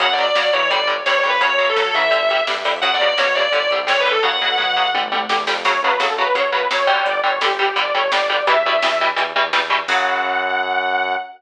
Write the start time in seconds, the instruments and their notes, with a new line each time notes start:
0.00 synth bass 1 F#2, overdriven guitar C#3 F#3, distortion guitar F#5, kick, closed hi-hat
0.13 distortion guitar D5
0.18 overdriven guitar C#3 F#3, closed hi-hat
0.23 distortion guitar D5
0.35 overdriven guitar C#3 F#3, synth bass 1 F#3, distortion guitar D5, snare
0.53 overdriven guitar C#3 F#3, synth bass 1 E3, distortion guitar C#5, closed hi-hat
0.70 synth bass 1 G1, overdriven guitar D3 G3, distortion guitar D5, kick, closed hi-hat
0.87 overdriven guitar D3 G3, closed hi-hat
1.06 synth bass 1 G2, overdriven guitar D3 G3, distortion guitar C#5, snare
1.18 distortion guitar C#5
1.23 synth bass 1 F2, overdriven guitar D3 G3, closed hi-hat
1.29 distortion guitar B4
1.41 synth bass 1 F#2, overdriven guitar C#3 F#3, distortion guitar C#5, kick, closed hi-hat
1.59 overdriven guitar C#3 F#3, closed hi-hat
1.69 distortion guitar A4
1.76 overdriven guitar C#3 F#3, synth bass 1 F#3, snare
1.94 overdriven guitar C#3 F#3, synth bass 1 E3, distortion guitar E5, closed hi-hat
2.11 synth bass 1 G1, overdriven guitar D3 G3, kick, closed hi-hat
2.29 overdriven guitar D3 G3, closed hi-hat
2.47 synth bass 1 G2, overdriven guitar D3 G3, snare
2.65 synth bass 1 F2, overdriven guitar D3 G3, open hi-hat
2.82 synth bass 1 F#2, overdriven guitar C#3 F#3, distortion guitar F#5, kick, closed hi-hat
2.94 distortion guitar D5
2.99 synth bass 1 B2, overdriven guitar C#3 F#3, closed hi-hat
3.07 distortion guitar D5
3.18 synth bass 1 B2, overdriven guitar C#3 F#3, distortion guitar C#5, snare
3.35 overdriven guitar C#3 F#3, distortion guitar D5, closed hi-hat
3.52 synth bass 1 G1, overdriven guitar D3 G3, distortion guitar D5, kick, closed hi-hat
3.70 synth bass 1 C2, overdriven guitar D3 G3, closed hi-hat
3.87 synth bass 1 C2, overdriven guitar D3 G3, distortion guitar C#5, snare
4.00 distortion guitar B4
4.05 overdriven guitar D3 G3, closed hi-hat
4.11 distortion guitar A4
4.23 synth bass 1 F#2, overdriven guitar C#3 F#3, distortion guitar F#5, kick, floor tom
4.41 synth bass 1 B2, overdriven guitar C#3 F#3, floor tom
4.58 synth bass 1 B2, overdriven guitar C#3 F#3, mid tom
4.77 overdriven guitar C#3 F#3
4.94 synth bass 1 G1, overdriven guitar D3 G3, high tom
5.11 synth bass 1 C2, overdriven guitar D3 G3, high tom
5.29 synth bass 1 E2, overdriven guitar D3 G3, snare
5.47 synth bass 1 F2, overdriven guitar D3 G3, snare
5.65 synth bass 1 F#2, overdriven guitar C#3 F#3, lead 2 (sawtooth) C#5, kick, crash
5.82 synth bass 1 F#2, overdriven guitar C#3 F#3, lead 2 (sawtooth) B4
6.00 synth bass 1 F#2, overdriven guitar C#3 F#3, lead 2 (sawtooth) A4, snare
6.18 overdriven guitar C#3 F#3, lead 2 (sawtooth) B4
6.35 synth bass 1 F#2, overdriven guitar C#3 F#3, lead 2 (sawtooth) C#5, kick, closed hi-hat
6.52 synth bass 1 F#2, overdriven guitar C#3 F#3, lead 2 (sawtooth) B4
6.70 synth bass 1 F#2, overdriven guitar C#3 F#3, lead 2 (sawtooth) C#5, snare
6.87 overdriven guitar D3 G3
7.06 synth bass 1 G1, lead 2 (sawtooth) D5, kick, closed hi-hat
7.24 synth bass 1 G1, overdriven guitar D3 G3, lead 2 (sawtooth) C#5
7.41 synth bass 1 G1, overdriven guitar D3 G3, lead 2 (sawtooth) G4, snare
7.58 overdriven guitar D3 G3, lead 2 (sawtooth) G4
7.76 synth bass 1 G1, overdriven guitar D3 G3, lead 2 (sawtooth) D5, kick, closed hi-hat
7.94 synth bass 1 G1, overdriven guitar D3 G3, lead 2 (sawtooth) C#5
8.11 synth bass 1 G1, overdriven guitar D3 G3, lead 2 (sawtooth) D5, snare
8.29 overdriven guitar D3 G3
8.47 synth bass 1 E2, overdriven guitar B2 E3 G3, lead 2 (sawtooth) E5, kick, closed hi-hat
8.64 synth bass 1 E2, overdriven guitar B2 E3 G3
8.82 synth bass 1 E2, overdriven guitar B2 E3 G3, snare
9.01 overdriven guitar B2 E3 G3
9.16 synth bass 1 E2, overdriven guitar B2 E3 G3, kick, closed hi-hat
9.35 synth bass 1 E2, overdriven guitar B2 E3 G3
9.53 synth bass 1 E2, overdriven guitar B2 E3 G3, snare
9.70 overdriven guitar B2 E3 G3
9.87 synth bass 1 F#2, overdriven guitar C#3 F#3, lead 2 (sawtooth) F#5, kick, crash